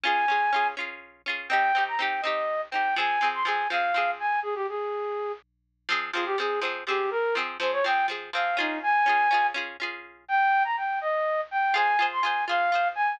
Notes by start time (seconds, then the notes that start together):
0.04 C#4 F4 G#4 G#5
0.28 C#4 F4 G#4
0.53 C#4 F4 G#4
0.77 C#4 F4 G#4
1.26 C#4 F4 G#4
1.49 C4 D#4 G4 G5
1.75 C4 D#4 G4
1.88 A#5
1.99 C4 D#4 G4 G5
2.22 C4 D#4 D#5
2.27 G4
2.71 C4 D#4 G5
2.75 G4
2.96 F3 C4 G#4 G#5
3.21 F3 C4 G#4
3.34 C6
3.45 F3 C4 G#4 G#5
3.70 F3 C4 G#4 F5
3.94 F3 C4 G#4
4.20 G#5
4.43 G#4
4.55 G4
4.69 G#4
5.89 F3 C4 G#4
6.13 F3 C4 F4
6.17 G#4
6.26 G4
6.38 F3 C4 G#4
6.61 F3 C4 G#4
6.87 F3 C4 G4 G#4
7.11 A#4
7.35 F3 C4 G#4
7.60 F3 C4 G#4 C5
7.73 C#5
7.84 F3 C4 G#4 G5
8.08 F3 C4 G#4
8.33 F3 C4 G#4 F5
8.57 C#4 D#4 F4 G#4
8.83 G#5
9.06 C#4 F4 G#4
9.31 C#4 F4 G#4
9.54 C#4 F4 G#4
9.80 C#4 F4 G#4
10.28 G5
10.64 A#5
10.77 G5
11.01 D#5
11.51 G5
11.74 F4 G#4 C5 G#5
11.99 F4 G#4 C5
12.13 C6
12.22 F4 G#4 G#5
12.26 C5
12.48 F4 G#4 C5 F5
12.72 F4 G#4 C5
12.95 G#5